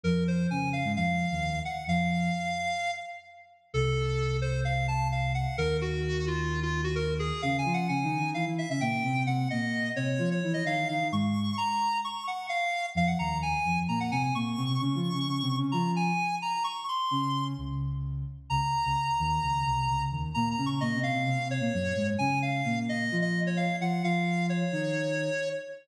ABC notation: X:1
M:4/4
L:1/16
Q:1/4=130
K:Bbm
V:1 name="Lead 1 (square)"
B2 c2 a2 f2 f6 g2 | f10 z6 | =A6 c2 f2 =a2 f2 g2 | B2 G4 F3 F2 G B2 A2 |
(3f2 a2 g2 a4 f z =e e =g4 | g2 e4 d3 d2 e f2 f2 | d'4 b4 d'2 g2 f4 | f g b2 a4 b g a a d'4 |
d'8 b2 a4 b2 | d'2 c'6 z8 | b16 | (3b2 b2 d'2 e2 f4 d6 |
a2 f4 e3 e2 d f2 g2 | f4 d10 z2 |]
V:2 name="Ocarina"
[F,,F,]4 [D,D]3 [A,,A,] [F,,F,]3 [E,,E,]3 z2 | [F,,F,]4 z12 | [C,,C,]16 | [E,,E,]16 |
[D,D]2 [F,F]2 (3[D,D]2 [E,E]2 [E,E]2 [=E,=E] [E,E]2 [D,D] [B,,B,]2 [C,C]2 | [C,C]2 [B,,B,]4 [C,C]2 [F,F]2 [=E,_F]2 [_E,E]2 [E,E] [E,E] | [A,,A,]4 z12 | [F,,F,]2 [E,,E,]4 [F,,F,]2 [B,,B,]2 [C,C]2 [B,,B,]2 [C,C] [C,C] |
(3[D,D]2 [F,F]2 [D,D]2 (3[D,D]2 [C,C]2 [D,D]2 [F,F]4 z4 | z4 [D,D]4 [D,,D,]6 z2 | [D,,D,] z2 [D,,D,] z2 [E,,E,]2 [D,,D,]2 [C,,C,]2 [D,,D,]2 [E,,E,]2 | [B,,B,]2 [D,D]2 (3[B,,B,]2 [C,C]2 [C,C]2 [C,C] [C,C]2 [B,,B,] [G,,G,]2 [A,,A,]2 |
[D,D]4 [B,,B,]4 [F,F]6 [F,F]2 | [F,F]6 [E,E]6 z4 |]